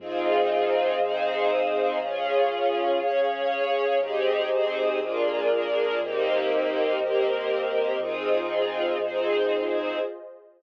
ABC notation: X:1
M:4/4
L:1/8
Q:1/4=120
K:Fm
V:1 name="String Ensemble 1"
[CEFA]4 [CEAc]4 | [DFA]4 [DAd]4 | [CEGA]2 [CEAc]2 [B,=DFA]2 [B,DAB]2 | [B,CEG]4 [B,CGB]4 |
[CEFA]4 [CEAc]4 |]
V:2 name="Pad 2 (warm)"
[Acef]8 | [Adf]8 | [GAce]4 [FAB=d]4 | [GBce]8 |
[FAce]8 |]
V:3 name="Synth Bass 2" clef=bass
F,,4 F,,4 | D,,4 D,,4 | A,,,4 B,,,4 | E,,4 E,,4 |
F,,4 F,,4 |]